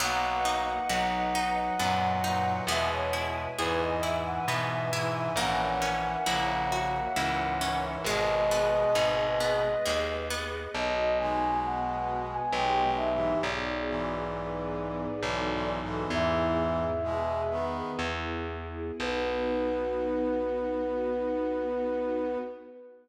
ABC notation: X:1
M:3/4
L:1/16
Q:1/4=67
K:B
V:1 name="Flute"
f12 | e c z2 B d e f e2 e e | f12 | d10 z2 |
d2 g2 f3 g =g2 e2 | =d12 | "^rit." e8 z4 | B12 |]
V:2 name="Brass Section"
[A,F]4 [F,D]4 [A,,F,]2 [A,,F,]2 | [B,,G,]4 [G,,E,]4 [G,,E,]2 [G,,E,]2 | [E,C]4 [C,A,]4 [G,,E,]2 [G,,E,]2 | [B,,G,]8 z4 |
z2 [B,,G,]6 (3[B,,G,]2 [B,,G,]2 [G,,E,]2 | z2 [G,,E,]6 (3[G,,E,]2 [G,,E,]2 [G,,E,]2 | "^rit." [G,,E,]4 [B,,G,]2 [D,B,]2 z4 | B,12 |]
V:3 name="Orchestral Harp"
B,2 D2 F2 D2 B,2 D2 | B,2 E2 G2 E2 B,2 E2 | A,2 C2 E2 F2 E2 C2 | G,2 B,2 D2 B,2 G,2 B,2 |
z12 | z12 | "^rit." z12 | z12 |]
V:4 name="Electric Bass (finger)" clef=bass
B,,,4 B,,,4 F,,4 | E,,4 E,,4 B,,4 | A,,,4 A,,,4 C,,4 | G,,,4 G,,,4 D,,4 |
B,,,8 B,,,4 | B,,,8 B,,,4 | "^rit." E,,8 E,,4 | B,,,12 |]
V:5 name="String Ensemble 1"
[Bdf]12 | [Beg]12 | [Acef]12 | [GBd]12 |
[B,DF]4 [B,FB]4 [B,D=G]4 | [B,DFG]4 [B,DGB]4 [B,DF=A]4 | "^rit." [B,EG]4 [B,GB]4 [B,EG]4 | [B,DF]12 |]